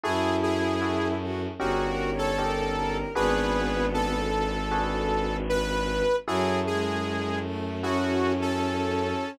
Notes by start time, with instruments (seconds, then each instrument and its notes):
0.03 violin F#2 E4, electric piano 1 E4 F#4 G#4 A4, lead 2 (sawtooth) G#4
0.43 lead 2 (sawtooth) G#4
0.82 electric piano 1 E4 F#4 G#4 A4
1.22 violin F#4
1.59 violin G1 G#4, electric piano 1 C#4 D#4 G4 A#4, lead 2 (sawtooth) F#4
1.86 violin A#4
2.12 violin C#5
2.18 lead 2 (sawtooth) A4
2.38 electric piano 1 C#4 D#4 G4 A#4, violin A#4
2.76 violin A#4
3.15 violin G#1 B3, electric piano 1 D4 F#4 G#4 B4, lead 2 (sawtooth) G#4 B4
3.94 lead 2 (sawtooth) A4
4.71 electric piano 1 D4 F#4 G#4 B4
5.49 lead 2 (sawtooth) B4
6.27 violin F#2 F#3, electric piano 1 E4 F#4 G#4 A4, lead 2 (sawtooth) G#4
6.66 violin G#3, lead 2 (sawtooth) G#4
7.44 violin A3
7.82 violin C#4, electric piano 1 E4 F#4 G#4 A4, lead 2 (sawtooth) F#4
8.41 lead 2 (sawtooth) A4